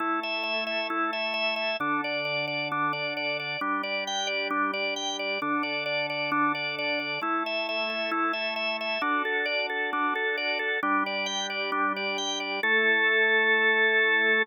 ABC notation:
X:1
M:4/4
L:1/8
Q:1/4=133
K:Amix
V:1 name="Drawbar Organ"
E e e e E e e e | D d d d D d d d | D d g d D d g d | D d d d D d d d |
E e e e E e e e | D A d A D A d A | D d g d D d g d | A8 |]
V:2 name="Drawbar Organ"
[A,EA]8 | [D,DA]8 | [G,DG]8 | [D,DA]8 |
[A,EA]8 | [DFA]8 | [G,DG]8 | [A,EA]8 |]